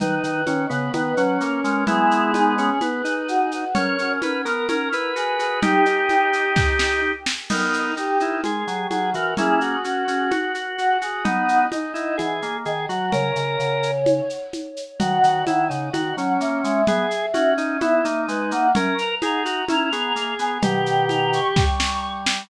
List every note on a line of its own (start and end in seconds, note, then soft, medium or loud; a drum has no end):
0.00 0.19 D#3 medium
0.00 0.42 D#4 medium
0.00 0.61 B4 medium
0.00 low conga loud
0.00 shaker medium
0.23 0.44 D#3 medium
0.23 shaker medium
0.46 0.66 D#3 medium
0.46 0.66 C#4 medium
0.46 high conga medium
0.46 shaker medium
0.70 0.90 C#3 medium
0.70 0.92 B3 medium
0.70 0.91 B4 medium
0.70 shaker medium
0.93 1.13 D#3 medium
0.93 1.15 B3 medium
0.93 1.36 B4 medium
0.93 high conga medium
0.93 shaker medium
1.17 1.38 F#3 medium
1.17 1.84 C#4 medium
1.17 shaker medium
1.41 1.60 A#3 medium
1.41 1.63 A#4 medium
1.41 shaker medium
1.64 1.84 G#3 loud
1.64 1.84 A#4 medium
1.64 shaker medium
1.87 2.70 G#3 medium
1.87 2.70 B3 loud
1.87 2.32 E4 medium
1.87 2.54 G#4 medium
1.87 low conga loud
1.87 shaker medium
2.11 shaker medium
2.34 2.55 D#4 medium
2.34 high conga medium
2.34 shaker medium
2.58 2.79 C#4 medium
2.58 2.80 G#4 medium
2.58 shaker medium
2.81 3.02 B3 medium
2.81 3.27 B4 medium
2.81 high conga medium
2.81 shaker medium
3.04 3.65 D#4 medium
3.04 shaker medium
3.28 3.49 F#4 medium
3.28 shaker medium
3.51 3.71 F#4 medium
3.51 shaker medium
3.75 3.96 C#4 loud
3.75 4.33 A#4 medium
3.75 4.13 C#5 medium
3.75 low conga loud
3.75 shaker medium
3.98 4.19 C#4 medium
3.98 shaker medium
4.22 4.45 C#4 medium
4.22 4.42 B4 medium
4.22 high conga medium
4.22 shaker medium
4.45 4.67 B3 medium
4.45 4.68 A#4 medium
4.45 4.65 A#4 medium
4.45 shaker medium
4.69 4.89 C#4 medium
4.69 5.14 A#4 medium
4.69 4.89 A#4 medium
4.69 high conga medium
4.69 shaker medium
4.92 5.11 E4 medium
4.92 5.60 B4 medium
4.92 shaker medium
5.16 5.37 F#4 medium
5.16 5.39 G#4 medium
5.16 shaker medium
5.39 5.61 F#4 medium
5.39 5.60 G#4 medium
5.39 shaker medium
5.62 5.85 D#4 medium
5.62 7.12 D#4 loud
5.62 7.12 G4 loud
5.62 6.59 G4 medium
5.62 low conga loud
5.62 shaker medium
5.86 7.01 D#4 medium
5.86 shaker medium
6.09 high conga medium
6.09 shaker medium
6.33 shaker medium
6.56 kick loud
6.56 snare medium
6.79 snare loud
7.26 snare loud
7.50 7.91 B3 medium
7.50 7.91 D#4 medium
7.50 7.94 D#4 medium
7.50 7.92 A#4 medium
7.50 crash loud
7.50 low conga loud
7.50 shaker medium
7.73 shaker medium
7.97 8.19 D#4 medium
7.97 8.35 G4 medium
7.97 shaker medium
8.20 8.41 D#4 medium
8.20 8.41 E4 medium
8.20 shaker medium
8.44 8.64 G#3 medium
8.44 8.87 G#4 medium
8.44 high conga medium
8.44 shaker medium
8.67 8.86 F#3 medium
8.67 shaker medium
8.91 9.12 F#3 medium
8.91 9.10 F#4 medium
8.91 9.10 G#4 medium
8.91 high conga medium
8.91 shaker medium
9.14 9.34 E3 medium
9.14 9.34 F#4 medium
9.14 9.33 A#4 medium
9.14 shaker medium
9.37 9.76 A#3 medium
9.37 9.76 C#4 medium
9.37 9.60 E4 medium
9.37 9.79 G#4 medium
9.37 low conga loud
9.37 shaker medium
9.61 10.98 F#4 medium
9.61 shaker medium
9.84 10.04 C#4 medium
9.84 10.30 F#4 medium
9.84 shaker medium
10.08 10.30 C#4 medium
10.08 shaker medium
10.31 10.52 F#4 medium
10.31 high conga medium
10.31 shaker medium
10.54 10.77 F#4 medium
10.54 shaker medium
10.78 11.00 F#4 medium
10.78 10.98 F#4 medium
10.78 shaker medium
11.01 11.24 F#4 medium
11.01 11.24 G#4 medium
11.01 shaker medium
11.25 11.66 B3 medium
11.25 11.65 D#4 medium
11.25 11.66 D#4 loud
11.25 11.64 F#5 medium
11.25 low conga loud
11.25 shaker medium
11.49 shaker medium
11.72 11.92 D#4 medium
11.72 12.15 D#5 medium
11.72 high conga medium
11.72 shaker medium
11.94 12.16 D#4 medium
11.94 12.17 E4 medium
11.94 shaker medium
12.18 12.41 E3 medium
12.18 12.57 G#4 medium
12.18 high conga medium
12.18 shaker medium
12.42 12.65 A#3 medium
12.42 shaker medium
12.65 12.86 D#3 medium
12.65 12.86 G#4 medium
12.65 12.88 D#5 medium
12.65 shaker medium
12.89 13.10 F#3 medium
12.89 13.12 F#4 medium
12.89 13.12 F#5 medium
12.89 shaker medium
13.12 13.32 C#3 loud
13.12 13.91 A#4 medium
13.12 14.37 C#5 medium
13.12 low conga medium
13.12 shaker medium
13.36 13.57 C#3 medium
13.36 shaker medium
13.59 14.21 C#3 medium
13.59 shaker medium
13.83 shaker medium
14.06 high conga loud
14.06 shaker medium
14.30 shaker medium
14.53 high conga medium
14.53 shaker medium
14.77 shaker medium
15.00 15.19 D#3 medium
15.00 15.45 F#4 medium
15.00 15.58 F#5 medium
15.00 low conga loud
15.00 shaker medium
15.23 15.43 D#3 medium
15.23 shaker medium
15.47 15.69 D#3 medium
15.47 15.68 E4 medium
15.47 high conga medium
15.47 shaker medium
15.69 15.90 C#3 medium
15.69 15.90 D#4 medium
15.69 15.90 F#5 medium
15.69 shaker medium
15.93 16.13 D#3 medium
15.93 16.16 F#4 medium
15.93 16.33 F#5 medium
15.93 high conga medium
15.93 shaker medium
16.17 16.37 F#3 medium
16.17 16.82 C#4 medium
16.17 shaker medium
16.41 16.61 A#3 medium
16.41 16.61 E5 medium
16.41 shaker medium
16.64 16.84 G#3 medium
16.64 16.85 E5 medium
16.64 shaker medium
16.87 17.06 B3 medium
16.87 17.26 G#4 medium
16.87 17.54 E5 medium
16.87 low conga loud
16.87 shaker medium
17.11 shaker medium
17.34 17.79 C#4 medium
17.34 17.54 F#4 medium
17.34 high conga medium
17.34 shaker medium
17.58 17.77 D#4 medium
17.58 17.78 E5 medium
17.58 shaker medium
17.81 18.01 B3 medium
17.81 18.04 E4 medium
17.81 18.22 E5 medium
17.81 high conga medium
17.81 shaker medium
18.05 18.26 A#3 medium
18.05 18.68 D#4 medium
18.05 shaker medium
18.28 18.51 G#3 medium
18.28 18.49 B4 medium
18.28 shaker medium
18.51 18.72 A#3 medium
18.51 18.70 F#5 medium
18.51 shaker medium
18.75 18.94 C#4 loud
18.75 19.15 A#4 medium
18.75 low conga loud
18.75 shaker medium
18.98 19.17 A#5 medium
18.98 shaker medium
19.22 19.62 D#4 medium
19.22 19.43 G#4 medium
19.22 19.66 A#5 medium
19.22 high conga medium
19.22 shaker medium
19.45 19.65 F#4 medium
19.45 shaker medium
19.69 19.91 C#4 medium
19.69 19.90 E4 medium
19.69 20.30 A#5 medium
19.69 high conga medium
19.69 shaker medium
19.92 20.12 B3 medium
19.92 20.58 G#4 medium
19.92 shaker medium
20.16 20.34 A#3 medium
20.16 shaker medium
20.39 20.58 B3 medium
20.39 20.61 G#5 medium
20.39 shaker medium
20.62 21.40 B2 medium
20.62 21.40 D#3 medium
20.62 21.65 G4 medium
20.62 21.00 G5 medium
20.62 low conga loud
20.62 shaker loud
20.86 shaker medium
21.09 21.29 A#5 medium
21.09 high conga medium
21.09 shaker medium
21.33 22.12 C#6 medium
21.33 shaker medium
21.56 22.42 G3 medium
21.56 kick loud
21.56 snare medium
21.80 snare loud
22.26 snare loud